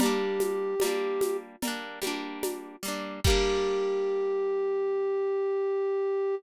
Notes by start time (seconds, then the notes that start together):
0.00 G3 A#3 G4, cowbell, low conga, shaker
0.06 D4
0.40 high conga, shaker
0.80 G3, cowbell, high conga, shaker
0.84 A#3 D4
1.21 high conga, shaker
1.62 G3 A#3, cowbell, low conga, shaker
1.68 D4
2.02 G3 A#3, high conga, shaker
2.07 D4
2.43 cowbell, high conga, shaker
2.83 G3 A#3, shaker
2.88 D4
3.24 G3 A#3 G4, kick, crash
3.30 D4